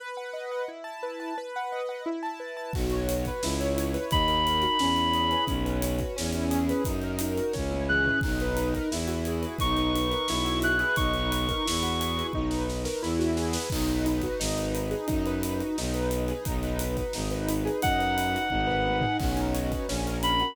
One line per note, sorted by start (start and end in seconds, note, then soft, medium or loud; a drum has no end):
0.00 0.65 B4 loud
0.17 0.51 F#5 medium
0.33 0.66 D#5 medium
0.51 0.68 F#5 medium
0.68 1.33 E4 medium
0.84 1.19 A5 medium
1.03 1.35 B4 medium
1.20 1.36 A5 medium
1.38 2.03 B4 loud
1.56 1.88 F#5 medium
1.72 2.05 D#5 medium
1.89 2.05 F#5 medium
2.06 2.71 E4 loud
2.23 2.56 A5 medium
2.40 2.72 B4 medium
2.57 2.73 A5 medium
2.73 3.29 B1 loud
2.73 3.07 F#4 medium
2.73 kick loud
2.73 crash medium
2.90 3.41 C#5 medium
2.90 closed hi-hat medium
3.07 3.40 F#4 medium
3.07 closed hi-hat loud
3.25 3.43 B4 medium
3.25 kick medium
3.25 closed hi-hat medium
3.42 3.97 C#2 loud
3.42 3.77 E4 loud
3.42 snare loud
3.60 4.09 C#5 medium
3.60 closed hi-hat medium
3.77 4.10 E4 medium
3.77 closed hi-hat loud
3.94 4.11 B4 medium
3.94 closed hi-hat medium
4.11 4.66 D#2 loud
4.11 4.45 D#4 loud
4.11 5.44 B5 medium
4.11 kick loud
4.11 closed hi-hat medium
4.28 4.77 A#4 medium
4.28 closed hi-hat medium
4.45 4.78 D#4 medium
4.45 closed hi-hat medium
4.62 4.79 F#4 medium
4.62 closed hi-hat medium
4.79 5.35 E2 loud
4.79 5.45 C#4 loud
4.79 snare loud
4.96 5.46 E4 medium
4.96 closed hi-hat medium
5.13 5.47 G#4 medium
5.13 closed hi-hat medium
5.31 5.48 B4 medium
5.31 closed hi-hat medium
5.47 6.02 B1 loud
5.47 5.83 C#4 loud
5.47 kick medium
5.47 closed hi-hat medium
5.65 6.14 B4 medium
5.65 closed hi-hat medium
5.82 6.16 C#4 medium
5.82 closed hi-hat loud
5.99 6.16 F#4 medium
5.99 kick medium
5.99 closed hi-hat medium
6.16 6.72 E2 loud
6.16 6.81 C#4 loud
6.16 snare loud
6.33 6.84 E4 medium
6.33 closed hi-hat medium
6.51 6.83 G#4 medium
6.51 closed hi-hat medium
6.69 6.86 B4 medium
6.69 closed hi-hat medium
6.85 7.40 F#2 loud
6.85 7.20 D#4 loud
6.85 kick medium
6.85 closed hi-hat medium
7.02 7.53 A#4 medium
7.02 closed hi-hat medium
7.19 7.53 D#4 medium
7.19 closed hi-hat loud
7.37 7.54 F#4 medium
7.37 closed hi-hat medium
7.53 8.09 C#2 loud
7.53 8.18 C#4 loud
7.53 kick medium
7.53 snare medium
7.71 8.20 E4 medium
7.71 high tom medium
7.89 8.22 G#4 medium
7.89 8.20 F#6 medium
7.89 mid tom medium
8.05 8.21 B4 medium
8.05 floor tom medium
8.21 8.78 B1 loud
8.21 8.56 D#4 loud
8.21 kick loud
8.21 crash medium
8.40 8.90 B4 medium
8.40 closed hi-hat medium
8.56 8.89 D#4 loud
8.56 closed hi-hat medium
8.74 8.90 A#4 loud
8.74 kick medium
8.74 closed hi-hat medium
8.91 9.46 E2 loud
8.91 9.57 E4 loud
8.91 snare loud
9.07 9.56 F#4 medium
9.07 closed hi-hat medium
9.25 9.60 G#4 medium
9.25 closed hi-hat medium
9.42 9.59 B4 medium
9.42 closed hi-hat medium
9.58 10.14 B1 loud
9.58 9.95 D#4 loud
9.58 10.59 C#6 medium
9.58 kick medium
9.58 closed hi-hat medium
9.77 10.27 B4 medium
9.77 closed hi-hat medium
9.95 10.28 D#4 medium
9.95 closed hi-hat medium
10.11 10.27 A#4 medium
10.11 closed hi-hat medium
10.28 10.83 B1 loud
10.28 10.95 E4 loud
10.28 snare loud
10.45 10.94 F#4 medium
10.45 closed hi-hat medium
10.62 10.97 G#4 medium
10.62 10.96 F#6 medium
10.62 closed hi-hat medium
10.79 10.96 B4 medium
10.79 closed hi-hat medium
10.96 11.52 B1 loud
10.96 11.31 D#4 loud
10.96 12.27 C#6 medium
10.96 kick loud
10.96 closed hi-hat medium
11.14 11.63 B4 medium
11.14 closed hi-hat medium
11.31 11.64 D#4 medium
11.31 closed hi-hat loud
11.49 11.65 A#4 medium
11.49 kick medium
11.49 closed hi-hat medium
11.65 12.22 E2 loud
11.65 12.31 E4 loud
11.65 snare loud
11.83 12.31 F#4 medium
11.83 snare soft
11.83 closed hi-hat medium
12.00 12.33 G#4 medium
12.00 closed hi-hat loud
12.17 12.33 B4 medium
12.17 closed hi-hat medium
12.33 12.87 B1 medium
12.33 12.68 D#4 loud
12.33 kick medium
12.50 12.99 B4 medium
12.50 snare medium
12.69 13.01 D#4 medium
12.69 snare medium
12.85 13.01 A#4 medium
12.85 snare medium
13.02 13.57 E2 loud
13.02 13.68 E4 loud
13.02 snare medium
13.19 13.68 F#4 medium
13.19 snare medium
13.37 13.69 G#4 medium
13.37 snare medium
13.53 13.70 B4 medium
13.53 snare loud
13.70 14.26 B1 loud
13.70 14.06 D#4 loud
13.70 kick loud
13.70 crash loud
13.88 14.39 B4 medium
13.88 closed hi-hat medium
14.06 14.39 D#4 medium
14.06 closed hi-hat medium
14.22 14.39 F#4 medium
14.22 kick medium
14.22 closed hi-hat medium
14.39 14.94 G#1 loud
14.39 14.74 D#4 loud
14.39 snare loud
14.56 15.05 B4 medium
14.56 closed hi-hat medium
14.75 15.07 D#4 medium
14.75 closed hi-hat medium
14.91 15.07 G#4 medium
14.91 snare soft
14.91 closed hi-hat medium
15.07 15.62 F#2 loud
15.07 15.43 D#4 loud
15.07 kick medium
15.07 closed hi-hat medium
15.26 15.75 B4 medium
15.26 closed hi-hat medium
15.43 15.76 D#4 medium
15.43 closed hi-hat loud
15.60 15.76 F#4 medium
15.60 closed hi-hat medium
15.78 16.33 B1 loud
15.78 16.11 D#4 loud
15.78 snare medium
15.94 16.43 B4 medium
15.94 closed hi-hat medium
16.11 16.44 D#4 medium
16.11 closed hi-hat medium
16.28 16.45 G#4 medium
16.28 closed hi-hat medium
16.45 17.01 B1 loud
16.45 16.80 D#4 loud
16.45 kick loud
16.45 closed hi-hat loud
16.62 17.12 B4 medium
16.62 snare soft
16.62 closed hi-hat medium
16.79 17.13 D#4 medium
16.79 closed hi-hat loud
16.97 17.13 F#4 medium
16.97 kick medium
16.97 snare soft
16.97 closed hi-hat medium
17.13 17.69 G#1 loud
17.13 17.49 D#4 loud
17.13 snare medium
17.30 17.80 B4 medium
17.30 snare soft
17.30 closed hi-hat medium
17.49 17.82 D#4 medium
17.49 closed hi-hat loud
17.65 17.81 G#4 medium
17.65 closed hi-hat medium
17.82 18.37 F#2 loud
17.82 18.17 D#4 loud
17.82 19.17 F#5 medium
17.82 kick loud
17.82 closed hi-hat loud
17.99 18.48 B4 medium
17.99 closed hi-hat medium
18.18 18.50 D#4 medium
18.18 closed hi-hat loud
18.34 18.50 F#4 medium
18.34 closed hi-hat medium
18.50 19.05 G#1 loud
18.50 18.84 D#4 loud
18.50 kick medium
18.50 high tom medium
18.67 19.16 B4 medium
18.67 floor tom medium
18.85 19.18 D#4 medium
18.85 high tom medium
19.01 19.19 G#4 medium
19.01 floor tom loud
19.19 19.74 B1 loud
19.19 19.84 C#4 loud
19.19 kick loud
19.19 crash medium
19.37 19.86 D#4 medium
19.37 closed hi-hat medium
19.54 19.87 F#4 medium
19.54 closed hi-hat medium
19.71 19.87 B4 medium
19.71 kick medium
19.71 closed hi-hat medium
19.88 20.43 A#1 loud
19.88 20.21 C#4 loud
19.88 snare loud
20.07 20.55 A#4 medium
20.07 closed hi-hat medium
20.22 20.54 C#4 medium
20.22 20.55 B5 medium
20.22 closed hi-hat loud
20.40 20.55 F#4 medium
20.40 closed hi-hat medium